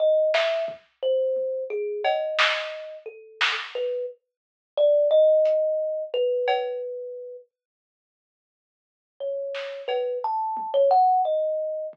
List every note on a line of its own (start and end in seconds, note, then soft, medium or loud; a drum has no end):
0.00 0.31 D#5 medium
0.34 0.65 E5 loud
0.34 snare medium
0.68 kick medium
1.03 1.64 C5 medium
1.36 high tom medium
1.70 2.01 G#4 medium
2.04 2.96 D#5 medium
2.04 cowbell loud
2.39 snare loud
3.06 3.52 A4 medium
3.41 snare loud
3.75 4.06 B4 medium
4.77 5.08 D5 loud
5.11 6.03 D#5 loud
5.45 closed hi-hat medium
6.14 7.37 B4 loud
6.48 cowbell loud
9.20 9.82 C#5 medium
9.20 floor tom medium
9.55 snare medium
9.88 10.19 B4 medium
9.88 cowbell medium
10.24 10.70 A5 loud
10.57 high tom medium
10.74 10.89 C#5 loud
10.91 11.22 F#5 loud
11.25 11.87 D#5 medium
11.93 kick medium